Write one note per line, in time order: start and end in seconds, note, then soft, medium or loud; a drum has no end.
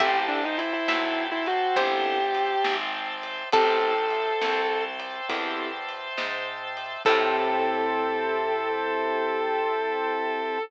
0.00 0.79 A1 medium
0.00 0.41 C4 medium
0.00 0.41 E4 medium
0.00 0.41 G4 medium
0.00 0.14 G4 medium
0.00 0.41 A4 loud
0.00 3.49 C5 medium
0.00 3.49 E5 medium
0.00 0.80 E5 loud
0.00 3.49 G5 medium
0.00 3.49 A5 medium
0.00 kick medium
0.00 crash medium
0.28 0.42 D4 medium
0.44 0.58 D#4 medium
0.58 0.72 E4 medium
0.58 ride medium
0.73 1.21 E4 medium
0.88 1.68 B1 medium
0.88 1.63 E5 medium
0.88 snare medium
1.32 1.46 E4 medium
1.46 1.76 F#4 medium
1.46 ride medium
1.76 2.56 G1 medium
1.76 2.18 C4 medium
1.76 2.18 E4 medium
1.76 2.71 G4 medium
1.76 2.18 G4 medium
1.76 2.18 A4 medium
1.76 3.43 C5 loud
1.76 kick medium
1.76 ride medium
2.35 ride medium
2.64 3.44 G#1 medium
2.64 snare medium
3.23 ride medium
3.52 4.32 A1 medium
3.52 3.94 C4 medium
3.52 3.94 E4 medium
3.52 3.94 G4 medium
3.52 3.94 A4 medium
3.52 4.60 A4 loud
3.52 4.79 A4 medium
3.52 7.02 C5 medium
3.52 7.02 E5 medium
3.52 7.02 G5 medium
3.52 7.02 A5 medium
3.52 kick loud
3.52 ride medium
4.11 ride medium
4.41 5.21 C2 medium
4.41 snare medium
5.00 ride medium
5.29 6.09 E2 medium
5.29 5.70 C4 medium
5.29 5.70 E4 medium
5.29 5.70 G4 medium
5.29 5.70 A4 medium
5.29 kick medium
5.29 ride medium
5.89 ride medium
6.17 6.97 G#2 medium
6.17 snare medium
6.77 ride medium
7.05 10.58 A2 loud
7.05 10.58 C4 loud
7.05 10.58 E4 loud
7.05 10.58 E4 medium
7.05 10.58 G4 medium
7.05 10.58 A4 loud
7.05 10.58 A4 medium
7.05 kick loud
7.05 crash loud